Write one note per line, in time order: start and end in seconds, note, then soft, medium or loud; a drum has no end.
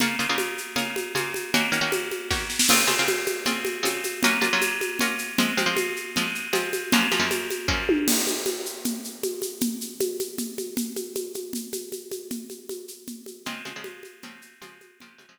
0.00 0.16 C#3 medium
0.00 0.16 A#3 medium
0.00 0.16 F4 medium
0.00 0.16 G#4 medium
0.00 low conga medium
0.00 shaker medium
0.19 0.27 C#3 medium
0.19 0.27 A#3 medium
0.19 0.27 F4 medium
0.19 0.27 G#4 medium
0.19 shaker medium
0.29 0.60 C#3 medium
0.29 0.60 A#3 medium
0.29 0.60 F4 medium
0.29 0.60 G#4 medium
0.38 high conga medium
0.38 shaker medium
0.58 shaker medium
0.76 1.07 C#3 medium
0.76 1.07 A#3 medium
0.76 1.07 F4 medium
0.76 1.07 G#4 medium
0.76 low conga medium
0.76 shaker medium
0.96 high conga medium
0.96 shaker medium
1.15 1.46 C#3 medium
1.15 1.46 A#3 medium
1.15 1.46 F4 medium
1.15 1.46 G#4 medium
1.15 high conga medium
1.15 shaker medium
1.34 high conga medium
1.34 shaker medium
1.54 1.69 D#3 medium
1.54 1.69 A#3 medium
1.54 1.69 C#4 medium
1.54 1.69 F#4 medium
1.54 low conga medium
1.54 shaker medium
1.72 1.80 D#3 medium
1.72 1.80 A#3 medium
1.72 1.80 C#4 medium
1.72 1.80 F#4 medium
1.72 shaker medium
1.81 2.12 D#3 medium
1.81 2.12 A#3 medium
1.81 2.12 C#4 medium
1.81 2.12 F#4 medium
1.92 high conga medium
1.92 shaker medium
2.11 high conga medium
2.11 shaker soft
2.30 2.61 D#3 medium
2.30 2.61 A#3 medium
2.30 2.61 C#4 medium
2.30 2.61 F#4 medium
2.30 kick medium
2.30 snare soft
2.50 snare medium
2.59 snare medium
2.69 2.85 C#3 medium
2.69 2.85 C4 medium
2.69 2.85 F4 medium
2.69 2.85 G#4 medium
2.69 crash medium
2.69 low conga medium
2.69 shaker medium
2.87 2.95 C#3 medium
2.87 2.95 C4 medium
2.87 2.95 F4 medium
2.87 2.95 G#4 medium
2.87 high conga medium
2.87 shaker medium
2.99 3.30 C#3 medium
2.99 3.30 C4 medium
2.99 3.30 F4 medium
2.99 3.30 G#4 medium
3.08 high conga medium
3.08 shaker medium
3.26 high conga medium
3.26 shaker medium
3.46 3.77 C#3 medium
3.46 3.77 C4 medium
3.46 3.77 F4 medium
3.46 3.77 G#4 medium
3.46 low conga medium
3.46 shaker medium
3.65 high conga medium
3.65 shaker soft
3.83 4.14 C#3 medium
3.83 4.14 C4 medium
3.83 4.14 F4 medium
3.83 4.14 G#4 medium
3.83 high conga medium
3.83 shaker medium
4.04 high conga soft
4.04 shaker medium
4.23 4.39 F#3 medium
4.23 4.39 A#3 medium
4.23 4.39 C#4 medium
4.23 4.39 F4 medium
4.23 low conga medium
4.23 shaker medium
4.41 4.49 F#3 medium
4.41 4.49 A#3 medium
4.41 4.49 C#4 medium
4.41 4.49 F4 medium
4.41 high conga medium
4.41 shaker medium
4.53 4.84 F#3 medium
4.53 4.84 A#3 medium
4.53 4.84 C#4 medium
4.53 4.84 F4 medium
4.61 high conga medium
4.61 shaker medium
4.81 high conga medium
4.81 shaker medium
4.99 5.31 F#3 medium
4.99 5.31 A#3 medium
4.99 5.31 C#4 medium
4.99 5.31 F4 medium
4.99 low conga medium
4.99 shaker medium
5.18 shaker medium
5.38 5.54 F3 medium
5.38 5.54 G#3 medium
5.38 5.54 C4 medium
5.38 low conga medium
5.38 shaker medium
5.57 5.65 F3 medium
5.57 5.65 G#3 medium
5.57 5.65 C4 medium
5.57 high conga medium
5.57 shaker medium
5.66 5.97 F3 medium
5.66 5.97 G#3 medium
5.66 5.97 C4 medium
5.77 high conga medium
5.77 shaker medium
5.96 shaker soft
6.16 6.47 F3 medium
6.16 6.47 G#3 medium
6.16 6.47 C4 medium
6.16 low conga medium
6.16 shaker medium
6.35 shaker soft
6.53 6.84 F3 medium
6.53 6.84 G#3 medium
6.53 6.84 C4 medium
6.53 high conga medium
6.53 shaker medium
6.73 high conga medium
6.73 shaker medium
6.92 7.08 F#2 medium
6.92 7.08 F3 medium
6.92 7.08 A#3 medium
6.92 7.08 C#4 medium
6.92 low conga medium
6.92 shaker medium
7.11 7.19 F#2 medium
7.11 7.19 F3 medium
7.11 7.19 A#3 medium
7.11 7.19 C#4 medium
7.11 high conga medium
7.11 shaker medium
7.19 7.50 F#2 medium
7.19 7.50 F3 medium
7.19 7.50 A#3 medium
7.19 7.50 C#4 medium
7.31 high conga medium
7.31 shaker medium
7.50 high conga medium
7.50 shaker medium
7.68 7.99 F#2 medium
7.68 7.99 F3 medium
7.68 7.99 A#3 medium
7.68 7.99 C#4 medium
7.68 kick medium
7.89 high tom medium
8.08 crash medium
8.08 low conga medium
8.08 shaker medium
8.27 high conga medium
8.27 shaker medium
8.46 high conga medium
8.46 shaker medium
8.66 shaker medium
8.85 low conga medium
8.85 shaker medium
9.04 shaker medium
9.23 high conga medium
9.23 shaker medium
9.42 high conga medium
9.42 shaker medium
9.61 low conga medium
9.61 shaker medium
9.81 shaker medium
10.00 high conga medium
10.00 shaker medium
10.19 high conga medium
10.19 shaker medium
10.38 low conga medium
10.38 shaker medium
10.58 high conga medium
10.58 shaker soft
10.77 low conga medium
10.77 shaker medium
10.96 high conga medium
10.96 shaker medium
11.15 high conga medium
11.15 shaker medium
11.34 high conga medium
11.34 shaker medium
11.53 low conga medium
11.53 shaker medium
11.73 high conga medium
11.73 shaker medium
11.92 high conga medium
11.92 shaker medium
12.11 high conga medium
12.11 shaker medium
12.31 low conga medium
12.31 shaker medium
12.50 high conga medium
12.50 shaker medium
12.69 high conga medium
12.69 shaker medium
12.88 shaker medium
13.07 low conga medium
13.07 shaker medium
13.26 high conga medium
13.26 shaker medium
13.45 13.62 C#3 medium
13.45 13.62 F3 medium
13.45 13.62 G#3 medium
13.45 13.62 C4 medium
13.45 low conga medium
13.45 shaker medium
13.65 13.73 C#3 medium
13.65 13.73 F3 medium
13.65 13.73 G#3 medium
13.65 13.73 C4 medium
13.65 high conga medium
13.65 shaker medium
13.76 14.07 C#3 medium
13.76 14.07 F3 medium
13.76 14.07 G#3 medium
13.76 14.07 C4 medium
13.84 high conga medium
13.84 shaker medium
14.03 high conga medium
14.03 shaker medium
14.22 14.54 C#3 medium
14.22 14.54 F3 medium
14.22 14.54 G#3 medium
14.22 14.54 C4 medium
14.22 low conga medium
14.22 shaker medium
14.42 shaker medium
14.62 14.92 C#3 medium
14.62 14.92 F3 medium
14.62 14.92 G#3 medium
14.62 14.92 C4 medium
14.62 high conga medium
14.62 shaker medium
14.81 high conga medium
14.81 shaker medium
15.00 15.17 C#3 medium
15.00 15.17 F3 medium
15.00 15.17 G#3 medium
15.00 15.17 C4 medium
15.00 low conga medium
15.00 shaker medium
15.18 15.26 C#3 medium
15.18 15.26 F3 medium
15.18 15.26 G#3 medium
15.18 15.26 C4 medium
15.18 high conga medium
15.18 shaker medium
15.29 15.39 C#3 medium
15.29 15.39 F3 medium
15.29 15.39 G#3 medium
15.29 15.39 C4 medium